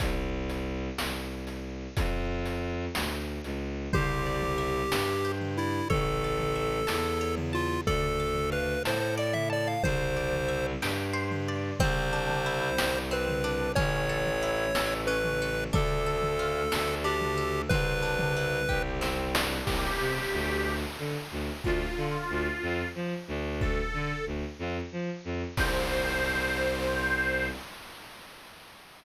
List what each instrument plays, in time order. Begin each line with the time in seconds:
0.00 violin C2, kick, closed hi-hat
0.49 closed hi-hat
0.98 violin C2, snare
1.47 closed hi-hat
1.97 violin F2, kick, closed hi-hat
2.45 closed hi-hat
2.95 violin D2, snare
3.44 violin C#2, closed hi-hat
3.93 violin C2, lead 1 (square) G4, orchestral harp C5, kick, floor tom
4.26 orchestral harp D5
4.42 floor tom
4.58 orchestral harp E5
4.92 violin G2, orchestral harp G5, snare
5.25 orchestral harp C5
5.41 floor tom
5.58 lead 1 (square) E4, orchestral harp D5
5.90 violin A1, lead 1 (square) A4, orchestral harp C#5, kick, floor tom
6.24 orchestral harp A5
6.40 floor tom
6.55 orchestral harp E5
6.87 violin E2, orchestral harp A5, snare
7.21 orchestral harp C#5
7.37 floor tom
7.53 lead 1 (square) F4, orchestral harp A5
7.87 violin D2, lead 1 (square) A4, orchestral harp D5, kick, floor tom
8.20 orchestral harp A5
8.35 floor tom
8.52 lead 1 (square) B4, orchestral harp F5
8.85 violin A2, lead 1 (square) C5, orchestral harp A5, snare
9.00 lead 1 (square) C5
9.17 orchestral harp D5, lead 1 (square) D5
9.33 lead 1 (square) E5, floor tom
9.50 lead 1 (square) D5, orchestral harp A5
9.67 lead 1 (square) F5
9.83 violin C2, lead 1 (square) C5, orchestral harp C5, kick, floor tom
10.17 orchestral harp D5
10.33 floor tom
10.48 orchestral harp E5
10.82 violin G2, orchestral harp G5, snare
11.13 orchestral harp C5
11.31 floor tom
11.48 orchestral harp D5
11.80 violin C2, orchestral harp C4, lead 1 (square) C5, kick, floor tom
12.13 orchestral harp D4
12.29 floor tom
12.46 orchestral harp E4
12.78 violin C2, orchestral harp G4, snare
13.11 orchestral harp C4, lead 1 (square) B4
13.28 floor tom
13.44 orchestral harp D4
13.75 violin A1, orchestral harp C#4, lead 1 (square) C#5, kick, floor tom
14.09 orchestral harp A4
14.26 floor tom
14.42 orchestral harp E4
14.75 violin A1, orchestral harp A4, snare
15.07 orchestral harp C#4, lead 1 (square) B4
15.24 floor tom
15.42 orchestral harp A4
15.73 violin D2, orchestral harp D4, lead 1 (square) A4, kick, floor tom
16.06 orchestral harp A4
16.22 floor tom
16.39 orchestral harp F4
16.72 violin D2, orchestral harp A4, snare
17.04 orchestral harp D4, lead 1 (square) G4
17.21 floor tom
17.37 orchestral harp A4
17.69 violin C2, orchestral harp C4, lead 1 (square) B4, kick, floor tom
18.02 orchestral harp D4
18.19 floor tom
18.36 orchestral harp E4
18.69 violin C2, orchestral harp G4, kick
19.01 orchestral harp C4, snare
19.35 orchestral harp D4, snare
19.65 violin C2, accordion G4, kick, crash
20.00 violin C3
20.33 violin D2
20.98 violin D3
21.31 violin D2
21.64 violin D2, accordion F4, kick
21.97 violin D3
22.30 violin D2
22.62 violin F2
22.95 violin F3
23.28 violin D2
23.61 accordion A4, kick
23.94 violin D3
24.26 violin D2
24.59 violin F2
24.92 violin F3
25.25 violin F2
25.57 violin C2, accordion C5, kick, crash